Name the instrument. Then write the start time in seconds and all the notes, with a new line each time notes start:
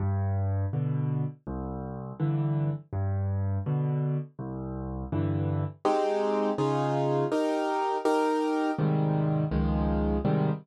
acoustic grand piano
0.00 G2
0.73 B2 D3
1.47 C2
2.20 G2 D3 E3
2.93 G2
3.66 B2 D3
4.39 C2
5.12 G2 D3 E3
5.85 G#3 C4 D#4 G4
6.58 C#3 D#4 F4 G#4
7.32 D#4 G4 A#4
8.05 D#4 G4 A#4
8.78 G#2 C3 D#3 G3
9.51 C#2 D#3 F3 G#3
10.25 G#2 C3 D#3 G3